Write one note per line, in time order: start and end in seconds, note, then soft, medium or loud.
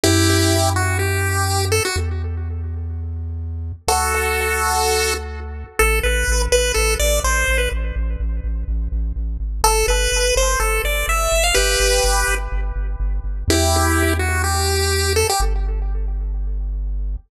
0.04 1.81 F#2 medium
0.04 0.70 E4 medium
0.04 0.70 G4 medium
0.76 0.98 F#4 medium
0.99 1.65 G4 medium
1.72 1.83 A4 medium
1.85 1.96 F#4 medium
1.96 3.73 E2 medium
3.88 5.64 D2 medium
3.88 5.14 F#4 medium
3.88 5.14 A4 medium
5.79 6.00 A1 medium
5.79 5.99 A4 medium
6.03 6.24 A1 medium
6.03 6.42 B4 medium
6.28 6.48 A1 loud
6.52 6.72 A1 medium
6.52 6.72 B4 medium
6.74 6.96 A1 medium
6.74 6.94 A4 medium
7.00 7.20 A1 medium
7.00 7.20 D5 medium
7.24 7.44 A1 medium
7.24 7.58 C5 medium
7.48 7.68 A1 medium
7.58 7.69 B4 medium
7.72 7.92 A1 medium
7.96 8.16 A1 medium
8.20 8.40 A1 medium
8.44 8.64 A1 medium
8.68 8.88 A1 medium
8.92 9.12 A1 medium
9.16 9.38 A1 medium
9.40 9.62 G#1 medium
9.64 9.84 G1 medium
9.64 9.86 A4 loud
9.88 10.08 G1 loud
9.88 10.35 B4 medium
10.12 10.32 G1 medium
10.36 10.56 G1 medium
10.36 10.59 C5 medium
10.60 10.80 G1 medium
10.60 10.82 A4 medium
10.84 11.04 G1 medium
10.84 11.06 D5 medium
11.08 11.28 G1 medium
11.08 11.44 E5 medium
11.32 11.52 G1 medium
11.44 11.55 F5 medium
11.54 11.76 G1 medium
11.54 12.35 G4 medium
11.54 12.35 B4 loud
11.80 12.00 G1 medium
12.04 12.24 G1 medium
12.28 12.48 G1 medium
12.52 12.72 G1 medium
12.76 12.96 G1 medium
13.00 13.20 G1 medium
13.24 13.44 G1 medium
13.48 15.24 E2 loud
13.48 14.14 E4 medium
13.48 14.14 G4 loud
14.19 14.42 F#4 medium
14.44 15.13 G4 medium
15.16 15.27 A4 medium
15.29 15.41 G4 loud
15.40 17.17 G1 loud